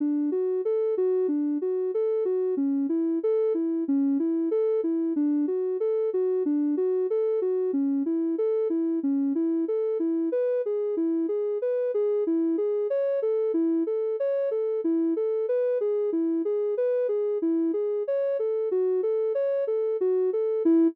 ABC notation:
X:1
M:4/4
L:1/8
Q:1/4=93
K:D
V:1 name="Ocarina"
D F A F D F A F | C E A E C E A E | D F A F D F A F | C E A E C E A E |
[K:E] B G E G B G E G | c A E A c A E A | B G E G B G E G | c A F A c A F A |
E2 z6 |]